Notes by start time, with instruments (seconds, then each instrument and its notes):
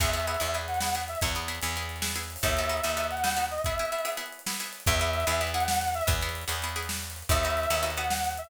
0.00 electric bass (finger) E2, pizzicato strings B3 E4 G#4, brass section E5, kick, crash
0.07 closed hi-hat
0.13 pizzicato strings B3 E4 G#4, closed hi-hat
0.20 closed hi-hat
0.27 pizzicato strings B3 E4 G#4, closed hi-hat
0.34 closed hi-hat
0.40 electric bass (finger) E2, pizzicato strings B3 E4 G#4, closed hi-hat
0.47 closed hi-hat
0.54 pizzicato strings B3 E4 G#4, closed hi-hat
0.61 closed hi-hat
0.68 brass section F#5, closed hi-hat
0.74 closed hi-hat
0.80 pizzicato strings B3 E4 G#4, snare
0.88 closed hi-hat
0.95 pizzicato strings B3 E4 G#4, closed hi-hat
1.02 closed hi-hat
1.08 brass section E5, closed hi-hat
1.15 closed hi-hat
1.21 electric bass (finger) E2, pizzicato strings B3 E4 G#4, kick, closed hi-hat
1.28 closed hi-hat
1.35 pizzicato strings B3 E4 G#4, closed hi-hat
1.42 closed hi-hat
1.48 pizzicato strings B3 E4 G#4, closed hi-hat
1.55 closed hi-hat
1.62 electric bass (finger) E2, pizzicato strings B3 E4 G#4, closed hi-hat
1.69 closed hi-hat
1.76 pizzicato strings B3 E4 G#4, closed hi-hat
1.82 closed hi-hat
1.89 closed hi-hat
1.96 closed hi-hat
2.02 pizzicato strings B3 E4 G#4, snare
2.10 closed hi-hat
2.16 pizzicato strings B3 E4 G#4, closed hi-hat
2.23 closed hi-hat
2.30 closed hi-hat
2.36 open hi-hat
2.43 electric bass (finger) D#2, pizzicato strings B3 D#4 F#4 A4, brass section E5, kick, closed hi-hat
2.50 closed hi-hat
2.57 pizzicato strings B3 D#4 F#4 A4, closed hi-hat
2.64 closed hi-hat
2.69 pizzicato strings B3 D#4 F#4 A4, closed hi-hat
2.77 closed hi-hat
2.84 electric bass (finger) D#2, pizzicato strings B3 D#4 F#4 A4, closed hi-hat
2.90 closed hi-hat
2.97 pizzicato strings B3 D#4 F#4 A4, closed hi-hat
3.04 closed hi-hat
3.11 brass section F#5, closed hi-hat
3.17 closed hi-hat
3.24 pizzicato strings B3 D#4 F#4 A4, snare
3.31 closed hi-hat
3.37 pizzicato strings B3 D#4 F#4 A4, closed hi-hat
3.45 closed hi-hat
3.51 brass section D#5, closed hi-hat
3.58 closed hi-hat
3.64 pizzicato strings B3 E4 G#4, brass section E5, kick, closed hi-hat
3.72 closed hi-hat
3.78 pizzicato strings B3 E4 G#4, closed hi-hat
3.85 closed hi-hat
3.92 pizzicato strings B3 E4 G#4, closed hi-hat
3.99 closed hi-hat
4.05 pizzicato strings B3 E4 G#4, closed hi-hat
4.12 closed hi-hat
4.17 pizzicato strings B3 E4 G#4, closed hi-hat
4.26 closed hi-hat
4.32 closed hi-hat
4.39 closed hi-hat
4.46 pizzicato strings B3 E4 G#4, snare
4.53 closed hi-hat
4.60 pizzicato strings B3 E4 G#4, closed hi-hat
4.66 closed hi-hat
4.73 closed hi-hat
4.80 closed hi-hat
4.86 electric bass (finger) E2, pizzicato strings B3 E4 G#4, brass section E5, kick, closed hi-hat
4.93 closed hi-hat
5.00 pizzicato strings B3 E4 G#4, closed hi-hat
5.07 closed hi-hat
5.13 closed hi-hat
5.20 closed hi-hat
5.27 electric bass (finger) E2, pizzicato strings B3 E4 G#4, closed hi-hat
5.34 closed hi-hat
5.41 pizzicato strings B3 E4 G#4, closed hi-hat
5.47 closed hi-hat
5.54 pizzicato strings B3 E4 G#4, brass section F#5, closed hi-hat
5.60 closed hi-hat
5.68 snare
5.75 closed hi-hat
5.81 closed hi-hat
5.87 closed hi-hat
5.94 brass section E5, closed hi-hat
6.01 closed hi-hat
6.07 electric bass (finger) E2, pizzicato strings B3 E4 G#4, kick, closed hi-hat
6.15 closed hi-hat
6.22 pizzicato strings B3 E4 G#4, closed hi-hat
6.29 closed hi-hat
6.35 closed hi-hat
6.41 closed hi-hat
6.48 electric bass (finger) E2, pizzicato strings B3 E4 G#4, closed hi-hat
6.56 closed hi-hat
6.62 pizzicato strings B3 E4 G#4, closed hi-hat
6.69 closed hi-hat
6.76 pizzicato strings B3 E4 G#4, closed hi-hat
6.83 closed hi-hat
6.89 snare
6.96 closed hi-hat
7.03 closed hi-hat
7.10 closed hi-hat
7.16 closed hi-hat
7.22 closed hi-hat
7.29 electric bass (finger) D#2, pizzicato strings B3 D#4 F#4 A4, brass section E5, kick, closed hi-hat
7.37 closed hi-hat
7.43 pizzicato strings B3 D#4 F#4 A4, closed hi-hat
7.50 closed hi-hat
7.57 closed hi-hat
7.63 closed hi-hat
7.70 electric bass (finger) D#2, pizzicato strings B3 D#4 F#4 A4, closed hi-hat
7.77 closed hi-hat
7.83 pizzicato strings B3 D#4 F#4 A4, closed hi-hat
7.90 closed hi-hat
7.97 pizzicato strings B3 D#4 F#4 A4, brass section F#5, closed hi-hat
8.04 closed hi-hat
8.10 snare
8.17 closed hi-hat
8.24 closed hi-hat
8.31 closed hi-hat
8.37 brass section E5, closed hi-hat
8.44 closed hi-hat